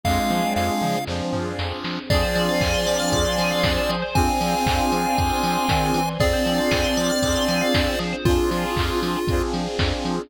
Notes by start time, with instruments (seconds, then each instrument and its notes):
0.03 synth bass 1 F2, lead 1 (square) G#3 F5, string ensemble 1 C4 D4 F4 G#4, lead 2 (sawtooth) C4 D4 F4 G#4, kick, snare
0.30 synth bass 1 F3, high tom
0.56 synth bass 1 F2, lead 1 (square) F5, snare
0.82 synth bass 1 F3, mid tom
1.07 synth bass 1 F2, lead 1 (square) F3, lead 2 (sawtooth) C4 D4 F4 G#4, string ensemble 1 C4 D4 G#4 C5, snare
1.33 synth bass 1 F3, floor tom
1.59 synth bass 1 F2, snare
1.84 synth bass 1 F3, snare
2.10 synth bass 1 F2, lead 1 (square) F3 D5, lead 2 (sawtooth) C4 D4 F4 G#4, tubular bells G#4, string ensemble 1 C5 D5 F5 G#5, kick, crash
2.23 tubular bells C5
2.35 synth bass 1 F3, tubular bells D5, open hi-hat
2.49 tubular bells F5
2.61 synth bass 1 F2, tubular bells G#5, kick, clap
2.74 tubular bells C6
2.87 synth bass 1 F3, tubular bells D6, open hi-hat
2.99 tubular bells F6
3.12 synth bass 1 F2, string ensemble 1 C5 D5 G#5 C6, tubular bells D6, kick, closed hi-hat
3.25 tubular bells C6
3.38 synth bass 1 F3, tubular bells G#5, open hi-hat
3.51 tubular bells F5
3.63 synth bass 1 F2, tubular bells D5, kick, snare
3.77 tubular bells C5
3.89 synth bass 1 F3, tubular bells G#4, open hi-hat
4.02 tubular bells C5
4.15 synth bass 1 F2, lead 2 (sawtooth) C4 D4 F4 G#4, lead 1 (square) C4 G#5, string ensemble 1 C5 D5 F5 G#5, kick, closed hi-hat
4.41 synth bass 1 F3, open hi-hat
4.66 synth bass 1 F2, kick, clap
4.92 synth bass 1 F3, open hi-hat
5.17 synth bass 1 F2, string ensemble 1 C5 D5 G#5 C6, kick, closed hi-hat
5.43 synth bass 1 F3, open hi-hat
5.69 synth bass 1 D#3, kick, snare
5.94 synth bass 1 E3, open hi-hat
6.19 synth bass 1 F2, lead 2 (sawtooth) C4 D4 F4 G#4, lead 1 (square) C4 D5, string ensemble 1 C4 D4 F4 G#4, tubular bells G#4, kick, closed hi-hat
6.33 tubular bells C5
6.46 synth bass 1 F3, tubular bells D5, open hi-hat
6.58 tubular bells F5
6.71 synth bass 1 F2, tubular bells G#5, kick, snare
6.84 tubular bells C6
6.97 synth bass 1 F3, tubular bells D6, open hi-hat
7.10 tubular bells F6
7.23 synth bass 1 F2, lead 2 (sawtooth) C4 D4 F4 G#4, tubular bells D6, kick, closed hi-hat
7.35 tubular bells C6
7.48 synth bass 1 F3, tubular bells G#5, open hi-hat
7.61 tubular bells F5
7.74 synth bass 1 F2, tubular bells D5, kick, snare
7.87 tubular bells C5
7.99 synth bass 1 F3, tubular bells G#4, open hi-hat
8.13 tubular bells C5
8.25 synth bass 1 F2, string ensemble 1 C4 D4 F4 G#4, lead 2 (sawtooth) C4 D4 F4 G#4, lead 1 (square) F4, kick, closed hi-hat
8.51 synth bass 1 F3, lead 1 (square) F4, open hi-hat
8.76 synth bass 1 F2, kick, clap
9.02 synth bass 1 F3, open hi-hat
9.27 synth bass 1 F2, lead 2 (sawtooth) C4 D4 F4 G#4, kick, closed hi-hat
9.53 synth bass 1 F3, open hi-hat
9.79 synth bass 1 F2, kick, snare
10.05 synth bass 1 F3, open hi-hat